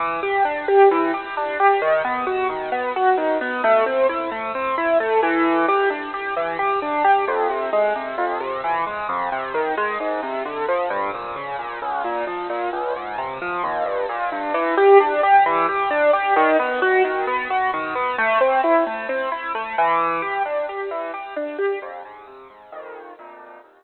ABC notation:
X:1
M:4/4
L:1/8
Q:1/4=132
K:Em
V:1 name="Acoustic Grand Piano"
E, G D G E, G D G | ^D, B, F D, B, F D, B, | A, C E A, C E A, E,- | E, G D G E, G D G |
[K:Fm] F,, C, A, C, F,, C, =E, A, | F,, C, E, A, A,, C, =D, F, | G,, B,, D, B,, D,, B,, F, B,, | D,, A,, C, F, E,, G,, B,, G,, |
[K:Em] E, G D G E, G D G | ^D, B, F D, B, F D, B, | A, C E A, C E A, E,- | E, G D G E, G D G |
[K:Fm] F,, A,, C, A,, [B,,,F,,E,]2 [=D,,F,,B,,]2 | E,, z7 |]